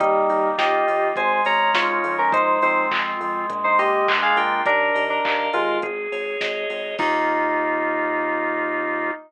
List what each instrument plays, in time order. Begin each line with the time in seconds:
0.00 synth bass 1 D#2, electric piano 2 G3 D#4, drawbar organ A#3, kick, closed hi-hat
0.29 synth bass 1 D#2, drawbar organ D#4, open hi-hat
0.58 synth bass 1 D#2, drawbar organ F4, electric piano 2 G4 D#5, kick, snare
0.87 synth bass 1 D#2, drawbar organ A#3, open hi-hat
1.16 synth bass 1 G#1, drawbar organ G#3, electric piano 2 C5 G#5, kick, closed hi-hat
1.45 synth bass 1 G#1, drawbar organ C#4, electric piano 2 C#5 A#5, open hi-hat
1.74 synth bass 1 G#1, drawbar organ D#4, electric piano 2 F4 C#5, kick, snare
2.04 synth bass 1 F2, drawbar organ G#3, open hi-hat
2.18 electric piano 2 C#4 A#4
2.32 drawbar organ G#3, electric piano 2 D#4 C5, kick, closed hi-hat
2.62 synth bass 1 F2, drawbar organ C4, electric piano 2 D#4 C5, open hi-hat
2.91 synth bass 1 F2, drawbar organ F4, kick, clap
3.20 synth bass 1 F2, drawbar organ G#3, open hi-hat
3.50 synth bass 1 A#1, kick, closed hi-hat
3.64 electric piano 2 D#4 C5
3.78 synth bass 1 A#1, drawbar organ A#3, electric piano 2 G4 D#5, open hi-hat
4.08 synth bass 1 A#1, drawbar organ D4, kick, clap
4.22 electric piano 2 G#4 F5
4.36 synth bass 1 A#1, drawbar organ F4, electric piano 2 A#4 G5, open hi-hat
4.66 synth bass 1 D#2, electric piano 2 D4 A#4, drawbar organ A#4, kick, closed hi-hat
4.94 synth bass 1 D#2, drawbar organ D#5, open hi-hat
5.10 electric piano 2 D4 A#4
5.24 synth bass 1 D#2, drawbar organ F5, kick, clap
5.53 synth bass 1 D#2, electric piano 2 G#3 F4, drawbar organ A#4, open hi-hat
5.82 synth bass 1 G#1, drawbar organ G#4, kick, closed hi-hat
6.12 synth bass 1 G#1, drawbar organ C#5, open hi-hat
6.41 synth bass 1 G#1, drawbar organ D#5, kick, snare
6.69 synth bass 1 G#1, drawbar organ G#4, open hi-hat
6.99 synth bass 1 D#2, drawbar organ A#3 D#4 F4, electric piano 2 D#4, kick, crash